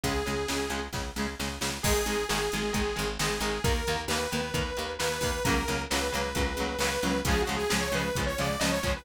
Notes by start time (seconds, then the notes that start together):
0.03 C#2 C#3 G#3 G#4, kick, closed hi-hat
0.26 C#2 C#3 G#3, closed hi-hat
0.48 C#2 C#3 G#3, snare
0.70 C#2 C#3 G#3, closed hi-hat
0.93 C#2 C#3 G#3, kick, snare
1.16 C#2 C#3 G#3, snare
1.39 C#2 C#3 G#3, snare
1.61 C#2 C#3 G#3, snare
1.83 G#1 D#3 G#3 G#4, kick, crash
2.06 G#1 D#3 G#3, closed hi-hat
2.29 G#1 D#3 G#3 G#4, snare
2.52 G#1 D#3 G#3, closed hi-hat
2.73 G#1 D#3 G#3, kick, closed hi-hat
2.96 G#1 D#3 G#3, closed hi-hat
3.19 G#1 D#3 G#3 G#4, snare
3.40 G#1 D#3 G#3, closed hi-hat
3.64 D#2 D#3 A#3 A#4, kick, closed hi-hat
3.87 D#2 D#3 A#3, closed hi-hat
4.08 D#2 D#3 A#3 B4, snare
4.32 D#2 D#3 A#3, closed hi-hat
4.54 D#2 D#3 A#3, kick, closed hi-hat
4.77 D#2 D#3 A#3, closed hi-hat
4.99 D#2 D#3 A#3 B4, snare
5.21 D#2 D#3 A#3, kick, open hi-hat
5.44 C#2 C#3 F#3 A#4, kick, closed hi-hat
5.48 A#3
5.68 C#2 C#3 F#3 A#3, closed hi-hat
5.90 C#2 C#3 F#3 A#3 B4, snare
6.12 C#2 C#3 F#3 A#3, closed hi-hat
6.35 C#2 C#3 F#3 A#3, kick, closed hi-hat
6.57 C#2 C#3 F#3, closed hi-hat
6.61 A#3
6.79 C#2 C#3 F#3 B4, snare
6.83 A#3
7.03 C#2 C#3 F#3 A#3, closed hi-hat
7.25 C#2 C#3 F3 G#4, kick, closed hi-hat
7.29 G#3
7.42 F#4
7.47 C#2 C#3 F3 G#3, closed hi-hat
7.56 G#4
7.70 C#2 C#3 F3 G#3 G#4, snare
7.81 C#5
7.92 C#2 C#3 F3 G#3 B4, closed hi-hat
8.15 C#2 C#3 F3 G#3, kick, closed hi-hat
8.27 C#5
8.38 C#2 C#3 F3 G#3 D5, closed hi-hat
8.60 C#2 C#3 F3 G#3 D#5, snare
8.72 C#5
8.83 C#2 C#3 F3 G#3, kick, closed hi-hat
8.96 B4